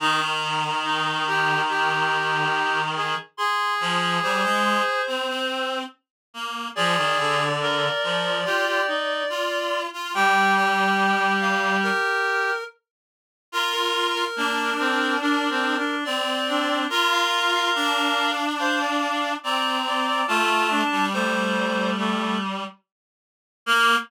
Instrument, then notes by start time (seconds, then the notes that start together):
clarinet
0.00 D#3 D#4 A#5
0.84 D#4
1.27 G4
1.69 G4
2.96 G#4
3.37 G#4 C6
3.80 F3
4.22 G3 C5
4.44 G#3
5.07 C4
5.28 C4
6.34 A#3
6.75 F3 G#4 D5
6.97 D#3
7.18 D3
7.61 A#4
8.03 F3
8.45 F4 G4
8.67 G4
8.87 D#4
9.29 F4
9.93 F4
10.14 G3 G4 G5
10.57 G5
11.41 F5
11.83 A#4
13.52 F4 A#4
13.72 A#4
14.14 A#4
14.36 A#3 D4
14.79 C4
15.21 D4 A#4
15.49 C4
15.77 D4
16.05 C4 D5
16.48 D4
16.89 F4 A#4
17.12 F5
17.53 F5
17.75 D4
18.59 C5 F5
18.80 D5
19.43 C4 D5 A#5
19.87 D5
20.07 D5
20.28 A3 F4 A5
20.70 D4
20.91 G3
21.13 A3 C5
21.98 A3
23.66 A#3 A#4